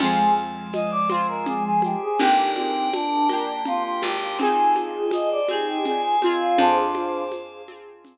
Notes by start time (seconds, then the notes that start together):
0.00 F2 F3 G#3 C4 F4 G#4 C5 F5 G#5, low conga, shaker
0.37 shaker
0.73 D#5, tambourine, high conga, shaker
0.91 D5
1.09 C4 F4 C5 G#5 C6, high conga, shaker
1.14 G#4
1.28 A#4
1.46 G#4, low conga, shaker
1.64 G#4
1.82 G4, high conga, shaker
2.02 G#4
2.19 G1 A#3 D4 D#4 G4 A#4 D5 G5, low conga, shaker
2.23 G4
2.55 C4, high conga, shaker
2.92 D4, tambourine, high conga, shaker
3.29 A#3 D4 G4 A#4 G5, high conga, shaker
3.33 G4
3.65 F4, low conga, shaker
3.83 F4
4.02 G#1 G4, high conga, shaker
4.39 C4 D#4 F4 G#4 C5 D#5 G#5, low conga, shaker
4.75 high conga, shaker
5.11 D#5, tambourine, high conga, shaker
5.31 D5
5.48 C4 D#4 G4 G#4 C5 G#5, high conga, shaker
5.53 G#4
5.66 G4
5.85 F4 G#4, low conga, shaker
6.02 G#4
6.22 C4 F4 G#4, high conga, shaker
6.40 F4
6.57 F2 D4 F4 G#4 C5 F5 G#5, low conga, shaker
6.95 high conga, shaker
7.31 tambourine, high conga, shaker
7.68 C4 F4 G#4 C5 G#5 C6, high conga, shaker
8.05 low conga, shaker